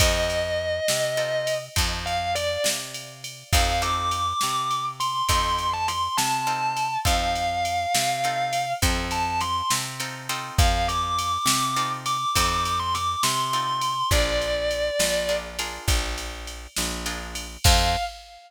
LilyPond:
<<
  \new Staff \with { instrumentName = "Distortion Guitar" } { \time 12/8 \key f \major \tempo 4. = 68 ees''2. r8 f''8 d''8 r4. | f''8 d'''2 c'''4~ c'''16 a''16 c'''8 a''4. | f''2. r8 a''8 c'''8 r4. | f''8 d'''2 d'''4~ d'''16 c'''16 d'''8 c'''4. |
d''2~ d''8 r2. r8 | f''4. r1 r8 | }
  \new Staff \with { instrumentName = "Acoustic Guitar (steel)" } { \time 12/8 \key f \major <c' ees' f' a'>2 <c' ees' f' a'>4 <c' ees' f' a'>2. | <c' ees' f' a'>8 <c' ees' f' a'>2~ <c' ees' f' a'>8 <c' ees' f' a'>2 <c' ees' f' a'>4 | <c' ees' f' a'>2 <c' ees' f' a'>4 <c' ees' f' a'>2 <c' ees' f' a'>8 <c' ees' f' a'>8~ | <c' ees' f' a'>2 <c' ees' f' a'>4 <c' ees' f' a'>2 <c' ees' f' a'>4 |
<d' f' aes' bes'>2 <d' f' aes' bes'>8 <d' f' aes' bes'>2~ <d' f' aes' bes'>8 <d' f' aes' bes'>4 | <c' ees' f' a'>4. r1 r8 | }
  \new Staff \with { instrumentName = "Electric Bass (finger)" } { \clef bass \time 12/8 \key f \major f,4. c4. f,4. c4. | f,4. c4. f,4. c4. | f,4. c4. f,4. c4. | f,4. c4. f,4. c4. |
bes,,4. bes,,4. bes,,4. bes,,4. | f,4. r1 r8 | }
  \new DrumStaff \with { instrumentName = "Drums" } \drummode { \time 12/8 <bd cymr>8 cymr4 sn8 cymr8 cymr8 <bd cymr>8 cymr8 cymr8 sn8 cymr8 cymr8 | <bd cymr>8 cymr8 cymr8 sn8 cymr8 cymr8 <bd cymr>8 cymr8 cymr8 sn8 cymr8 cymr8 | <bd cymr>8 cymr8 cymr8 sn8 cymr8 cymr8 <bd cymr>8 cymr8 cymr8 sn8 cymr8 cymr8 | <bd cymr>8 cymr8 cymr8 sn8 cymr8 cymr8 <bd cymr>8 cymr8 cymr8 sn8 cymr8 cymr8 |
<bd cymr>8 cymr8 cymr8 sn8 cymr8 cymr8 <bd cymr>8 cymr8 cymr8 sn8 cymr8 cymr8 | <cymc bd>4. r4. r4. r4. | }
>>